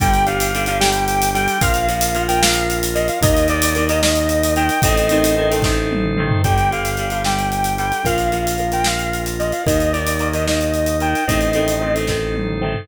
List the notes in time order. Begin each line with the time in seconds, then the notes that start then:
0.00 G1 D3 G3 D4 G4 G5, kick, closed hi-hat
0.14 closed hi-hat
0.26 D3 G3 F5, closed hi-hat
0.40 closed hi-hat
0.54 D3 G3, closed hi-hat
0.66 D3 G3 F5, closed hi-hat
0.80 D3 G3 G5, snare
0.92 closed hi-hat
1.08 closed hi-hat
1.22 closed hi-hat
1.34 D3 G3 G5, closed hi-hat
1.48 closed hi-hat
1.61 A#1 F3 A#3 F4 A#4 F5, kick, closed hi-hat
1.74 closed hi-hat
1.88 F3 A#3, closed hi-hat
2.01 closed hi-hat
2.15 F3 A#3, closed hi-hat
2.28 F3 A#3 G5, closed hi-hat
2.42 F3 A#3 F5, snare
2.54 closed hi-hat
2.70 closed hi-hat
2.83 closed hi-hat
2.95 F3 A#3 D#5, closed hi-hat
3.08 F5, closed hi-hat
3.21 D#2 D#3 A#3 D#4 A#4 D#5, kick, closed hi-hat
3.37 closed hi-hat
3.48 D#3 A#3 D5, closed hi-hat
3.62 closed hi-hat
3.75 D#3 A#3, closed hi-hat
3.89 D#3 A#3 D#5, closed hi-hat
4.03 D#3 A#3 D#5, snare
4.15 closed hi-hat
4.29 closed hi-hat
4.43 closed hi-hat
4.56 D#3 A#3 G5, closed hi-hat
4.69 closed hi-hat
4.82 A1 D#3 A3 C4 D#4 A4 C5 D#5, kick, closed hi-hat
4.97 closed hi-hat
5.09 D#3 A3 C4, closed hi-hat
5.24 closed hi-hat
5.37 D#3 A3 C4
5.50 D#3 A3 C4, closed hi-hat
5.62 D#3 A3 C4, kick, snare
5.92 high tom
6.04 mid tom
6.17 D#3 A3 C4, mid tom
6.30 floor tom
6.44 G1 D3 G3 D4 G4 G5, kick, closed hi-hat
6.58 closed hi-hat
6.71 D3 G3 F5, closed hi-hat
6.85 closed hi-hat
6.97 D3 G3, closed hi-hat
7.10 D3 G3 F5, closed hi-hat
7.24 D3 G3 G5, snare
7.39 closed hi-hat
7.52 closed hi-hat
7.64 closed hi-hat
7.78 D3 G3 G5, closed hi-hat
7.92 closed hi-hat
8.04 A#1 F3 A#3 F4 A#4 F5, kick, closed hi-hat
8.18 closed hi-hat
8.32 F3 A#3, closed hi-hat
8.47 closed hi-hat
8.58 F3 A#3, closed hi-hat
8.72 F3 A#3 G5, closed hi-hat
8.84 F3 A#3 F5, snare
8.99 closed hi-hat
9.13 closed hi-hat
9.26 closed hi-hat
9.39 F3 A#3 D#5, closed hi-hat
9.52 F5, closed hi-hat
9.66 D#2 D#3 A#3 D#4 A#4 D#5, kick, closed hi-hat
9.80 closed hi-hat
9.92 D#3 A#3 D5, closed hi-hat
10.07 closed hi-hat
10.19 D#3 A#3, closed hi-hat
10.33 D#3 A#3 D#5, closed hi-hat
10.47 D#3 A#3 D#5, snare
10.61 closed hi-hat
10.74 closed hi-hat
10.86 closed hi-hat
11.00 D#3 A#3 G5, closed hi-hat
11.15 closed hi-hat
11.27 A1 D#3 A3 C4 D#4 A4 C5 D#5, kick, closed hi-hat
11.41 closed hi-hat
11.53 D#3 A3 C4, closed hi-hat
11.68 closed hi-hat
11.81 D#3 A3 C4
11.95 D#3 A3 C4, closed hi-hat
12.07 D#3 A3 C4, kick, snare
12.35 high tom
12.47 mid tom
12.62 D#3 A3 C4, mid tom
12.75 floor tom